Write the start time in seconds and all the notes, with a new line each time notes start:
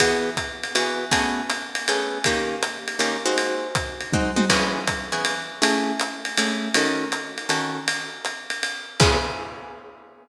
0.00 E3 B3 F#4 G#4, kick, ride
0.37 kick, hi-hat pedal, ride
0.63 ride
0.75 E3 B3 F#4 G#4, ride
1.11 A3 B3 C#4 G#4, kick, ride
1.50 hi-hat pedal, ride
1.75 ride
1.88 A3 B3 C#4 G#4, ride
2.24 D#3 A#3 C#4 G4, kick, ride
2.63 hi-hat pedal, ride
2.88 ride
2.99 D#3 A#3 C#4 G4, ride
3.26 G#3 C4 D#4 F#4
3.38 ride
3.75 kick, hi-hat pedal, ride
4.01 ride
4.12 G#3 C4 D#4 F#4, kick, high tom
4.36 G#3 C4 D#4 F#4, high tom
4.50 E3 B3 C#4 G#4, kick, crash, ride
4.87 kick, hi-hat pedal, ride
5.12 E3 B3 C#4 G#4, ride
5.25 ride
5.62 A3 C#4 E4 G#4, ride
6.00 hi-hat pedal, ride
6.25 ride
6.37 A3 C#4 E4 G#4, ride
6.74 D#3 C#4 F#4 A4, ride
7.12 hi-hat pedal, ride
7.38 ride
7.49 D#3 C#4 F#4 A4, ride
7.88 ride
8.25 hi-hat pedal, ride
8.50 ride
8.63 ride
9.00 C#3 B3 E4 G#4, kick, crash